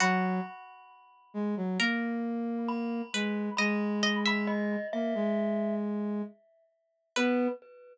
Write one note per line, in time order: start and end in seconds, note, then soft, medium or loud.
0.00 0.40 F#3 loud
0.00 1.73 F#4 loud
0.00 2.58 B5 medium
1.34 1.55 G#3 loud
1.57 1.78 F#3 loud
1.79 3.02 A#3 loud
1.79 2.96 A#4 medium
2.68 3.51 B5 medium
3.14 3.50 G#3 loud
3.14 3.58 B4 medium
3.57 4.76 G#3 loud
3.57 4.01 D#5 loud
3.57 4.16 B5 medium
4.03 4.24 D#5 loud
4.26 6.80 E5 medium
4.26 4.49 B5 medium
4.47 4.87 D#5 medium
4.93 5.14 A#3 medium
4.93 5.75 E5 medium
5.15 6.22 G#3 loud
7.16 7.48 B3 loud
7.16 7.48 B4 loud
7.16 7.49 B4 loud